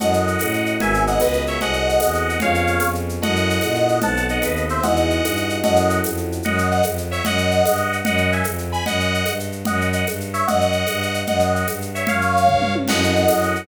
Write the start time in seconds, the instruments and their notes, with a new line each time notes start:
0.00 violin F#2, electric piano 1 C#4 E4 F#4 A4, lead 2 (sawtooth) D#5 F#5, low conga, shaker
0.13 shaker
0.27 shaker
0.39 violin A2, tambourine, high conga, shaker
0.53 shaker
0.66 shaker
0.80 violin G#1, electric piano 1 B3 F#4 G#4 A#4, lead 2 (sawtooth) E5 G#5, low conga, shaker
0.94 shaker
1.07 lead 2 (sawtooth) D#5 F#5, shaker
1.20 violin C#2, lead 2 (sawtooth) B4 D#5, tambourine, high conga, shaker
1.33 shaker
1.47 lead 2 (sawtooth) C#5 E5, shaker
1.61 violin C2, electric piano 1 C4 F#4 G#4 A4, lead 2 (sawtooth) D#5 F#5, low conga, shaker
1.73 shaker
1.89 shaker
2.00 violin E2, tambourine, high conga, shaker
2.14 shaker
2.29 shaker
2.40 violin F2, electric piano 1 B3 C#4 F4 G#4, lead 2 (sawtooth) C#5 F5, low conga, shaker
2.54 shaker
2.67 shaker
2.80 violin F2, tambourine, high conga, shaker
2.95 shaker
3.09 shaker
3.22 violin F#2, electric piano 1 C#4 E4 F#4 A4, lead 2 (sawtooth) D#5 F#5, low conga, shaker
3.36 shaker
3.50 shaker
3.61 violin A#2, tambourine, high conga, shaker
3.75 shaker
3.89 shaker
4.01 violin B1, electric piano 1 B3 C4 D#4 A4, lead 2 (sawtooth) F#5 A5, low conga, shaker
4.17 shaker
4.29 lead 2 (sawtooth) D#5 F#5, shaker
4.42 violin D#2, lead 2 (sawtooth) B4 D#5, tambourine, high conga, shaker
4.56 shaker
4.69 lead 2 (sawtooth) C5 E5, shaker
4.83 violin E2, electric piano 1 D#4 E4 F#4 G#4, lead 2 (sawtooth) D#5 F#5, low conga, shaker
4.96 shaker
5.10 shaker
5.23 violin G2, tambourine, high conga, shaker
5.36 shaker
5.50 shaker
5.63 violin F#2, electric piano 1 C#4 E4 F#4 A4, lead 2 (sawtooth) D#5 F#5, low conga, shaker
5.76 shaker
5.90 shaker
6.04 violin F2, tambourine, high conga, shaker
6.17 shaker
6.32 shaker
6.43 violin F#2, lead 2 (sawtooth) D#5 F#5, low conga, shaker
6.58 shaker
6.71 lead 2 (sawtooth) D#5 F#5, shaker
6.83 violin F2, tambourine, high conga, shaker
6.98 shaker
7.11 lead 2 (sawtooth) C#5 E5, shaker
7.25 violin F#2, lead 2 (sawtooth) D#5 F#5, low conga, shaker
7.38 shaker
7.51 shaker
7.65 violin G2, tambourine, high conga, shaker
7.77 shaker
7.93 shaker
8.05 violin F#2, lead 2 (sawtooth) D#5 F#5, low conga, shaker
8.18 shaker
8.32 lead 2 (sawtooth) E5 G#5, shaker
8.44 violin F2, tambourine, high conga, shaker
8.58 shaker
8.72 lead 2 (sawtooth) G#5 B5, shaker
8.86 violin F#2, lead 2 (sawtooth) D#5 F#5, low conga, shaker
9.00 shaker
9.14 shaker
9.26 violin G2, tambourine, high conga, shaker
9.40 shaker
9.52 shaker
9.65 violin F#2, lead 2 (sawtooth) D#5 F#5, low conga, shaker
9.81 shaker
9.93 lead 2 (sawtooth) D#5 F#5, shaker
10.07 violin G2, tambourine, high conga, shaker
10.21 shaker
10.34 lead 2 (sawtooth) C#5 E5, shaker
10.47 violin F#2, lead 2 (sawtooth) D#5 F#5, low conga, shaker
10.61 shaker
10.72 shaker
10.87 violin G2, tambourine, high conga, shaker
11.02 shaker
11.14 shaker
11.27 violin F#2, lead 2 (sawtooth) D#5 F#5, low conga, shaker
11.40 shaker
11.55 lead 2 (sawtooth) D#5 F#5, shaker
11.68 violin G2, tambourine, high conga, shaker
11.82 shaker
11.95 lead 2 (sawtooth) C#5 E5, shaker
12.07 violin F#2, lead 2 (sawtooth) C#5 F5, low conga, shaker
12.21 shaker
12.37 shaker
12.47 violin G2, kick, floor tom
12.62 mid tom
12.75 high tom
12.88 violin F#2, electric piano 1 C#4 E4 F#4 A4, lead 2 (sawtooth) D#5 F#5, crash, low conga, shaker
13.04 shaker
13.16 shaker
13.28 violin F#2, tambourine, high conga, shaker
13.42 shaker
13.56 shaker